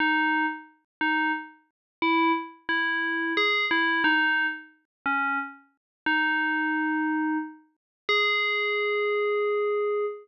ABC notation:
X:1
M:3/4
L:1/16
Q:1/4=89
K:G#m
V:1 name="Tubular Bells"
D3 z3 D2 z4 | E2 z2 E4 G2 E2 | D3 z3 C2 z4 | D8 z4 |
G12 |]